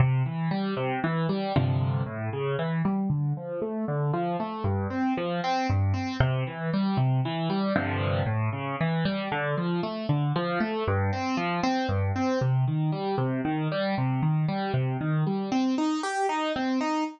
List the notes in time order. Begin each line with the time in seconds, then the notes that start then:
0.00 C3
0.26 E3
0.51 G3
0.77 C3
1.04 E3
1.29 G3
1.56 G2 C3 D3 F3
2.06 A2
2.33 C#3
2.59 E3
2.85 G3
3.10 D3
3.37 F3
3.62 A3
3.88 D3
4.13 F3
4.40 A3
4.64 G2
4.90 C4
5.17 F3
5.44 C4
5.70 G2
5.94 C4
6.20 C3
6.47 E3
6.73 G3
6.97 C3
7.25 E3
7.50 G3
7.76 G2 C3 D3 F3
8.26 A2
8.53 C#3
8.81 E3
9.05 G3
9.32 D3
9.57 F3
9.83 A3
10.09 D3
10.36 F3
10.60 A3
10.87 G2
11.13 C4
11.37 F3
11.63 C4
11.88 G2
12.16 C4
12.41 C3
12.67 D#3
12.92 G3
13.18 C3
13.45 D#3
13.72 G3
13.98 C3
14.23 D#3
14.48 G3
14.74 C3
15.01 D#3
15.27 G3
15.52 C4
15.78 D#4
16.03 G4
16.29 D#4
16.56 C4
16.81 D#4